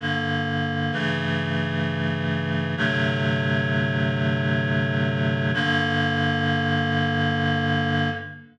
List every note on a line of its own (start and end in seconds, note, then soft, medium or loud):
0.01 0.91 G2 medium
0.01 0.92 D3 medium
0.01 0.92 A#3 medium
0.92 2.75 G2 medium
0.92 2.75 C#3 medium
0.92 2.75 E3 medium
0.92 2.75 A3 medium
2.77 5.51 G2 medium
2.77 5.51 C3 medium
2.77 5.51 D3 medium
2.77 5.51 F#3 medium
2.77 5.51 A3 medium
5.54 8.09 G2 loud
5.54 8.09 D3 loud
5.54 8.09 A#3 loud